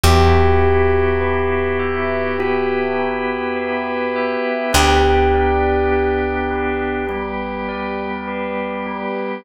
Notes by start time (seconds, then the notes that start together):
0.03 E2 B3 E4 F#4 G4
0.64 G4
1.21 B4
1.79 E5
2.39 B3 E4 F#4 G4 B4
2.99 G4
3.56 B4
4.16 E5
4.73 D2 B3 D4 G4
5.34 D5
5.92 G4
6.51 B4
7.09 G3 B3 G4
7.69 D5
8.27 B4
8.87 G4